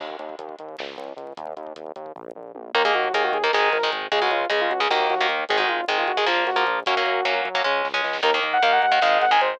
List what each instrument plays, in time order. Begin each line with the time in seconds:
0.00 synth bass 1 D#2, kick, crash
0.10 kick
0.19 synth bass 1 D#2, kick, closed hi-hat
0.29 kick
0.39 synth bass 1 D#2, kick, closed hi-hat
0.49 kick
0.59 synth bass 1 D#2, kick, closed hi-hat
0.69 kick
0.78 synth bass 1 C#2, kick, snare
0.88 kick
0.97 synth bass 1 C#2, kick, closed hi-hat
1.08 kick
1.17 synth bass 1 C#2, kick, closed hi-hat
1.27 kick
1.37 synth bass 1 D#2, kick, closed hi-hat
1.47 kick
1.57 synth bass 1 D#2, kick, closed hi-hat
1.67 kick
1.75 synth bass 1 D#2, kick, closed hi-hat
1.87 kick
1.96 synth bass 1 D#2, kick, closed hi-hat
2.06 kick
2.16 synth bass 1 A#1, kick, floor tom
2.35 synth bass 1 A#1, mid tom
2.55 synth bass 1 A#1, high tom
2.75 synth bass 1 D#2, overdriven guitar D#3 A#3, lead 2 (sawtooth) A#4, kick, crash
2.84 overdriven guitar D#3 A#3, lead 2 (sawtooth) G#4, kick
2.94 synth bass 1 D#2, lead 2 (sawtooth) F#4, kick, closed hi-hat
3.04 kick
3.13 synth bass 1 D#2, overdriven guitar D#3 A#3, lead 2 (sawtooth) G#4, kick, closed hi-hat
3.23 lead 2 (sawtooth) F#4, kick
3.33 synth bass 1 D#2, lead 2 (sawtooth) G#4, kick, closed hi-hat
3.43 overdriven guitar D#3 A#3, lead 2 (sawtooth) A#4, kick
3.53 synth bass 1 G#1, overdriven guitar D#3 G#3, lead 2 (sawtooth) G#4, kick, snare
3.63 kick
3.72 synth bass 1 G#1, lead 2 (sawtooth) A#4, kick, closed hi-hat
3.83 overdriven guitar D#3 G#3, kick
3.92 synth bass 1 G#1, kick, closed hi-hat
4.02 kick
4.12 synth bass 1 C#2, overdriven guitar C#3 G#3, lead 2 (sawtooth) G#4, kick, closed hi-hat
4.21 overdriven guitar C#3 G#3, lead 2 (sawtooth) F#4, kick
4.30 synth bass 1 C#2, lead 2 (sawtooth) F4, kick, closed hi-hat
4.41 kick
4.50 synth bass 1 C#2, overdriven guitar C#3 G#3, lead 2 (sawtooth) G#4, kick, closed hi-hat
4.61 lead 2 (sawtooth) F4, kick
4.71 synth bass 1 C#2, lead 2 (sawtooth) F#4, kick, closed hi-hat
4.80 overdriven guitar C#3 G#3, lead 2 (sawtooth) G#4, kick
4.90 synth bass 1 D#2, overdriven guitar D#3 A#3, lead 2 (sawtooth) F#4, kick, snare
5.00 kick
5.10 synth bass 1 D#2, lead 2 (sawtooth) F#4, kick, closed hi-hat
5.19 overdriven guitar D#3 A#3, kick
5.29 synth bass 1 D#2, kick, closed hi-hat
5.39 kick
5.49 synth bass 1 G#1, overdriven guitar D#3 G#3, lead 2 (sawtooth) G#4, kick, closed hi-hat
5.57 overdriven guitar D#3 G#3, lead 2 (sawtooth) F#4, kick
5.68 synth bass 1 G#1, lead 2 (sawtooth) F4, kick, closed hi-hat
5.78 kick
5.88 synth bass 1 G#1, overdriven guitar D#3 G#3, lead 2 (sawtooth) G#4, kick, closed hi-hat
5.98 lead 2 (sawtooth) F4, kick
6.08 synth bass 1 G#1, lead 2 (sawtooth) F#4, kick, closed hi-hat
6.17 overdriven guitar D#3 G#3, lead 2 (sawtooth) G#4, kick
6.26 synth bass 1 A#1, overdriven guitar F3 A#3, lead 2 (sawtooth) F4, kick, snare
6.37 kick
6.47 synth bass 1 A#1, lead 2 (sawtooth) F#4, kick, closed hi-hat
6.56 overdriven guitar F3 A#3, kick
6.67 synth bass 1 A#1, kick, closed hi-hat
6.76 kick
6.86 synth bass 1 F#2, overdriven guitar F#3 A#3 C#4, lead 2 (sawtooth) F#4, kick, closed hi-hat
6.96 overdriven guitar F#3 A#3 C#4, kick
7.06 synth bass 1 F#2, kick, closed hi-hat
7.16 kick
7.25 synth bass 1 F#2, overdriven guitar F#3 A#3 C#4, kick, closed hi-hat
7.35 kick
7.45 synth bass 1 F#2, kick, closed hi-hat
7.54 overdriven guitar F#3 A#3 C#4, kick
7.64 synth bass 1 C#2, overdriven guitar G#3 C#4, kick, snare
7.85 synth bass 1 C#2, snare
7.94 overdriven guitar G#3 C#4
8.04 synth bass 1 C#2, snare
8.13 snare
8.23 synth bass 1 D#2, overdriven guitar D#3 A#3, lead 2 (sawtooth) A#4, kick, crash
8.34 overdriven guitar D#3 A#3, kick
8.43 synth bass 1 D#2, kick, closed hi-hat
8.53 lead 2 (sawtooth) F#5, kick
8.63 synth bass 1 D#2, overdriven guitar D#3 A#3, lead 2 (sawtooth) F5, kick, closed hi-hat
8.72 lead 2 (sawtooth) F#5, kick
8.82 synth bass 1 D#2, lead 2 (sawtooth) F#5, kick, closed hi-hat
8.92 overdriven guitar D#3 A#3, lead 2 (sawtooth) F#5, kick
9.02 synth bass 1 G#1, overdriven guitar D#3 G#3, lead 2 (sawtooth) F5, kick, snare
9.12 kick
9.21 synth bass 1 G#1, lead 2 (sawtooth) F#5, kick, closed hi-hat
9.31 overdriven guitar D#3 G#3, lead 2 (sawtooth) G#5, kick
9.41 synth bass 1 G#1, lead 2 (sawtooth) C5, kick, closed hi-hat
9.51 kick